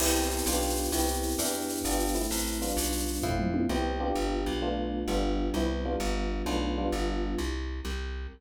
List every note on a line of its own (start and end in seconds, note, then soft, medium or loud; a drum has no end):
0.00 0.42 C2 loud
0.00 0.46 B3 medium
0.00 0.46 C4 medium
0.00 0.46 E4 medium
0.00 0.46 G4 medium
0.00 crash loud
0.07 shaker medium
0.16 shaker medium
0.23 shaker medium
0.31 shaker medium
0.38 shaker medium
0.46 0.89 B1 loud
0.46 0.91 B3 medium
0.46 0.93 D4 medium
0.46 0.93 F4 medium
0.46 0.91 G4 medium
0.46 shaker loud
0.53 shaker medium
0.62 shaker medium
0.70 shaker medium
0.77 shaker medium
0.85 shaker medium
0.92 1.35 C2 loud
0.92 1.37 B3 medium
0.92 1.37 C4 medium
0.92 1.37 E4 medium
0.92 1.37 G4 medium
0.92 shaker loud
1.00 shaker medium
1.08 shaker medium
1.15 shaker medium
1.23 shaker medium
1.31 shaker medium
1.38 1.81 E2 loud
1.38 1.84 B3 medium
1.38 1.84 D4 medium
1.38 1.84 E4 medium
1.38 1.84 G4 medium
1.38 shaker loud
1.46 shaker medium
1.54 shaker medium
1.61 shaker medium
1.69 shaker medium
1.77 shaker medium
1.84 2.27 G1 medium
1.84 2.15 B3 medium
1.84 2.15 D4 medium
1.84 2.15 F4 medium
1.84 2.15 G4 medium
1.84 shaker loud
1.92 shaker medium
2.00 shaker medium
2.08 shaker medium
2.15 2.59 A3 medium
2.15 2.59 C4 medium
2.15 2.59 E4 medium
2.15 shaker medium
2.23 shaker medium
2.31 2.73 A1 loud
2.31 shaker loud
2.38 shaker medium
2.46 shaker medium
2.54 shaker medium
2.62 3.22 G3 medium
2.62 3.22 B3 medium
2.62 3.22 D4 medium
2.62 3.22 F4 medium
2.62 shaker medium
2.69 shaker medium
2.77 3.19 B1 loud
2.77 shaker loud
2.85 shaker medium
2.92 shaker medium
3.00 shaker medium
3.08 shaker medium
3.15 shaker medium
3.23 3.66 F2 loud
3.23 3.69 A3 medium
3.23 3.69 C4 medium
3.23 3.69 E4 medium
3.23 3.69 F4 medium
3.23 kick medium
3.23 floor tom medium
3.39 mid tom loud
3.54 high tom loud
3.69 4.12 C2 loud
3.69 3.99 B3 medium
3.69 3.99 C4 medium
3.69 3.99 E4 medium
3.69 3.99 G4 medium
4.00 4.61 B3 medium
4.00 4.61 D4 medium
4.00 4.61 F4 medium
4.00 4.61 G4 medium
4.15 4.45 G1 loud
4.46 5.04 B1 medium
4.62 5.07 A3 medium
4.62 5.07 B3 medium
4.62 5.07 D4 medium
4.62 5.07 F4 medium
5.08 5.50 G1 loud
5.08 5.53 G3 medium
5.08 5.53 B3 medium
5.08 5.53 D4 medium
5.08 5.53 F4 medium
5.54 5.96 C2 loud
5.54 5.85 G3 medium
5.54 5.85 B3 medium
5.54 5.85 C4 medium
5.54 5.85 E4 medium
5.85 6.46 G3 medium
5.85 6.45 B3 medium
5.85 6.45 D4 medium
5.85 6.45 F4 medium
6.00 6.42 G1 loud
6.46 6.89 B1 loud
6.46 6.75 A3 medium
6.46 6.75 B3 medium
6.46 6.75 D4 medium
6.46 6.75 F4 medium
6.78 7.38 G3 medium
6.78 7.38 B3 medium
6.78 7.38 D4 medium
6.78 7.38 F4 medium
6.92 7.35 G1 loud
7.38 7.81 C2 loud
7.85 8.27 C2 loud